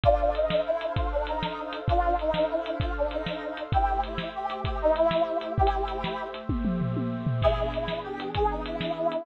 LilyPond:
<<
  \new Staff \with { instrumentName = "Brass Section" } { \time 12/8 \key a \minor \tempo 4. = 130 <d' f'>4 dis'4 e'4 f'8 d'8 ees'2 | <d' f'>4 dis'4 e'4 f'8 d'8 ees'2 | <e' g'>4 e'4 g'4 g'8 dis'8 e'2 | <e' g'>2~ <e' g'>8 r2. r8 |
<e' gis'>4 e'4 g'4 gis'8 dis'8 e'2 | }
  \new Staff \with { instrumentName = "Pad 2 (warm)" } { \time 12/8 \key a \minor <d' a' c'' f''>1. | <d' a' c'' f''>1. | <a g' c'' e''>1. | <a g' c'' e''>1. |
<e b d' gis'>1. | }
  \new DrumStaff \with { instrumentName = "Drums" } \drummode { \time 12/8 <hh bd>4 hh8 sn4 hh8 <hh bd>4 hh8 sn4 hh8 | <hh bd>4 hh8 sn4 hh8 <hh bd>4 hh8 sn4 hh8 | <hh bd>4 hh8 sn4 hh8 <hh bd>4 hh8 sn4 hh8 | \tuplet 3/2 { bd16 r16 hh16 r16 r16 r16 hh16 r16 r16 } sn4 hh8 <bd tommh>8 toml8 tomfh8 tommh4 tomfh8 |
<cymc bd>4 hh8 sn4 hh8 <hh bd>4 hh8 sn4 hh8 | }
>>